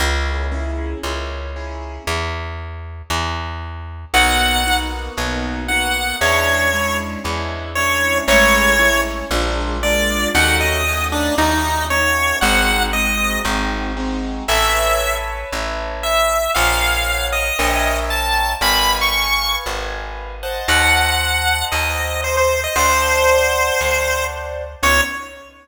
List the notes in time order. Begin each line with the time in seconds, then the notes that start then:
0.00 C#2 A#3 C#4 E4 G#4
0.52 A#3 C#4 E4 G#4
1.03 C#2 A#3 C#4 E4 G#4
1.56 A#3 C#4 E4 G#4
2.07 E2
3.10 E2
4.14 B1 A#3 B3 D#4 F#4 F#5
4.66 A#3 B3 D#4 F#4
5.17 B1 A#3 B3 D#4 F#4
5.68 A#3 B3 D#4 F#4 F#5
6.21 E2 G#3 C#4 D4 E4 C#5
6.73 G#3 C#4 D4 E4
7.24 E2 G#3 C#4 D4 E4
7.75 G#3 C#4 D4 E4 C#5
8.27 A1 G#3 A3 C#4 E4 C#5
8.79 G#3 A3 C#4 E4
9.31 A#1 G#3 A#3 D4 F4
9.83 G#3 A#3 D4 F4 D5
10.34 D#2 A3 C#4 D#4 F#4 F#5
10.60 D#5
10.87 A3 C#4 D#4 F#4
11.12 D4
11.38 D#2 A3 C#4 D#4 F#4
11.90 A3 C#4 D#4 F#4 C#5
12.41 G#1 G#3 C4 D#4 F#4 F#5
12.93 G#3 C4 D#4 F#4 D#5
13.45 G#1 G#3 C4 D#4 F#4
13.97 G#3 C4 D#4 F#4
14.48 A1 B4 C#5 E5 A5
15.52 A1
16.03 E5
16.55 A#1 A#4 C#5 F5 F#5
17.32 D#5
17.59 A#1 A#4 C#5 E5 G5
18.10 A5
18.61 G#1 B4 D#5 F5 G#5 B5
19.01 C#6
19.66 G#1
20.43 C5 D#5 F#5 A5
20.68 D#2 F#5
21.72 D#2 D#5
22.24 C5
22.37 C5
22.64 D#5
22.76 D2 C5 D5 F#5 A5
23.80 D2
24.83 C#2 B3 C#4 D#4 E4 C#5